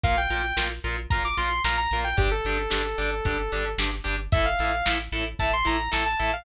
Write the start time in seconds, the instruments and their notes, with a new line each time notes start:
0.03 synth bass 1 A#1, overdriven guitar F4 A#4, lead 2 (sawtooth) F5, kick, closed hi-hat
0.17 lead 2 (sawtooth) G5
0.30 synth bass 1 A#1, overdriven guitar F4 A#4, closed hi-hat
0.57 synth bass 1 A#1, overdriven guitar F4 A#4, snare
0.84 synth bass 1 A#1, overdriven guitar F4 A#4, closed hi-hat
1.10 synth bass 1 A#1, overdriven guitar F4 A#4, lead 2 (sawtooth) A#5, kick, closed hi-hat
1.25 lead 2 (sawtooth) D6
1.37 synth bass 1 A#1, overdriven guitar F4 A#4, lead 2 (sawtooth) C6, closed hi-hat
1.64 synth bass 1 A#1, overdriven guitar F4 A#4, lead 2 (sawtooth) A#5, snare
1.77 lead 2 (sawtooth) A#5
1.91 synth bass 1 A#1, overdriven guitar F4 A#4, closed hi-hat
2.04 lead 2 (sawtooth) G5
2.17 synth bass 1 G1, overdriven guitar D4 G4, lead 2 (sawtooth) G4, kick, closed hi-hat
2.31 lead 2 (sawtooth) A4
2.45 synth bass 1 G1, overdriven guitar D4 G4, closed hi-hat
2.70 synth bass 1 G1, overdriven guitar D4 G4, snare
2.98 synth bass 1 G1, overdriven guitar D4 G4, closed hi-hat
3.25 synth bass 1 G1, overdriven guitar D4 G4, kick, closed hi-hat
3.52 synth bass 1 G1, overdriven guitar D4 G4, closed hi-hat
3.78 synth bass 1 G1, overdriven guitar D4 G4, snare
4.04 synth bass 1 G1, overdriven guitar D4 G4, closed hi-hat
4.32 synth bass 1 A1, overdriven guitar E4 A4, lead 2 (sawtooth) E5, kick, closed hi-hat
4.45 lead 2 (sawtooth) F5
4.59 synth bass 1 A1, overdriven guitar E4 A4, closed hi-hat
4.86 synth bass 1 A1, overdriven guitar E4 A4, snare
5.12 synth bass 1 A1, overdriven guitar E4 A4, closed hi-hat
5.39 synth bass 1 A1, overdriven guitar E4 A4, lead 2 (sawtooth) A5, kick, closed hi-hat
5.53 lead 2 (sawtooth) C6
5.65 synth bass 1 A1, overdriven guitar E4 A4, lead 2 (sawtooth) A#5, closed hi-hat
5.92 synth bass 1 A1, overdriven guitar E4 A4, lead 2 (sawtooth) A5, snare
6.06 lead 2 (sawtooth) A5
6.20 synth bass 1 A1, overdriven guitar E4 A4, closed hi-hat
6.33 lead 2 (sawtooth) F5